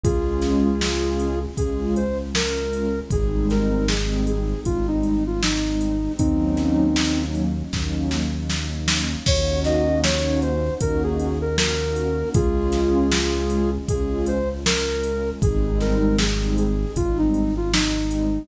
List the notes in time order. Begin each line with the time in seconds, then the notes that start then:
0.04 C#2 G#3 C#4 F4 G#4, kick, closed hi-hat
0.42 snare, closed hi-hat
0.81 G#3 C#4 F4, snare
1.19 closed hi-hat
1.41 G#3 C#4 F4
1.57 C#2 G#4, kick, closed hi-hat
1.96 C5, closed hi-hat
2.18 G#3 C#4 F4
2.34 G#3 C#4 F4 A#4, snare
2.56 G#3 C#4 F4
2.73 closed hi-hat
2.96 G#3 C#4 F4
3.10 G#1 G3 G#3 C4 D#4 G#4, kick, closed hi-hat
3.50 A#4, snare, closed hi-hat
3.88 G3 G#3 C4 D#4 G#4, snare
4.26 G#4, closed hi-hat
4.50 G3 G#3 C4 D#4
4.65 G#1 F4, kick, closed hi-hat
4.88 D#4
5.03 closed hi-hat
5.26 G3 G#3 C4 D#4 F4
5.41 G3 G#3 C4 D#4, snare
5.64 G3 G#3 C4 D#4
5.81 closed hi-hat
6.04 G3 G#3 C4 D#4
6.18 D#2 F#3 A#3 C4 C#4 D#4, kick, closed hi-hat
6.57 snare, closed hi-hat
6.96 F#3 A#3 C#4 D#4, snare
7.35 closed hi-hat
7.57 F#3 A#3 C#4 D#4
7.73 D#2, kick, snare
8.11 snare
8.34 F#3 A#3 C#4 D#4
8.49 F#3 A#3 C#4 D#4, snare
8.72 F#3 A#3 C#4 D#4
8.88 snare
9.12 F#3 A#3 C#4 D#4
9.26 D#2 A#3 C#4 D#4 F#4 C#5, kick, crash
9.64 D#5, snare, closed hi-hat
10.03 A#3 C#4 D#4 F#4 C#5, snare
10.42 C5, closed hi-hat
10.66 A#3 C#4 D#4 F#4
10.80 D#2 A#4, kick, closed hi-hat
11.03 G#4
11.20 closed hi-hat
11.41 A#3 C#4 D#4 F#4 A#4
11.58 A#3 C#4 D#4 F#4 A#4, snare
11.80 A#3 C#4 D#4 F#4
11.96 closed hi-hat
12.18 A#3 C#4 D#4 F#4
12.34 C#2 G#3 C#4 F4 G#4, kick, closed hi-hat
12.72 snare, closed hi-hat
13.11 G#3 C#4 F4, snare
13.50 closed hi-hat
13.71 G#3 C#4 F4
13.88 C#2 G#4, kick, closed hi-hat
14.26 C5, closed hi-hat
14.48 G#3 C#4 F4
14.65 G#3 C#4 F4 A#4, snare
14.88 G#3 C#4 F4
15.04 closed hi-hat
15.26 G#3 C#4 F4
15.42 G#1 G3 G#3 C4 D#4 G#4, kick, closed hi-hat
15.80 A#4, snare, closed hi-hat
16.18 G3 G#3 C4 D#4 G#4, snare
16.58 G#4, closed hi-hat
16.81 G3 G#3 C4 D#4
16.96 G#1 F4, kick, closed hi-hat
17.18 D#4
17.34 closed hi-hat
17.56 G3 G#3 C4 D#4 F4
17.73 G3 G#3 C4 D#4, snare
17.97 G3 G#3 C4 D#4
18.11 closed hi-hat
18.35 G3 G#3 C4 D#4